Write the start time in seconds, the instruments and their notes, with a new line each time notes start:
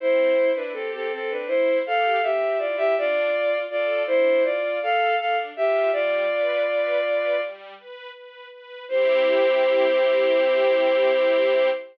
0.00 string ensemble 1 C4, violin E4 C5
0.37 string ensemble 1 E4
0.55 violin D4 B4
0.73 violin C4 A4, string ensemble 1 G4
0.94 violin C4 A4
1.12 string ensemble 1 C4, violin C4 A4
1.31 violin D4 B4
1.47 violin E4 C5, string ensemble 1 E4
1.86 string ensemble 1 G4, violin A4 F5
2.22 string ensemble 1 C4, violin G4 E5
2.59 string ensemble 1 E4, violin F4 D5
2.77 violin G4 E5
2.97 string ensemble 1 D4, violin F4 D5
3.33 string ensemble 1 F4
3.70 violin F4 D5, string ensemble 1 A4
4.07 string ensemble 1 D4, violin E4 C5
4.44 violin F4 D5, string ensemble 1 F4
4.82 string ensemble 1 A4, violin A4 F5
5.19 string ensemble 1 D4, violin A4 F5
5.56 string ensemble 1 F4, violin G4 E5
5.92 string ensemble 1 G3, violin F4 D5
6.30 string ensemble 1 B4
6.67 string ensemble 1 B4
7.04 string ensemble 1 B4
7.41 string ensemble 1 G3
7.77 string ensemble 1 B4
8.15 string ensemble 1 B4
8.52 string ensemble 1 B4
8.88 string ensemble 1 C4 E4 G4, violin C5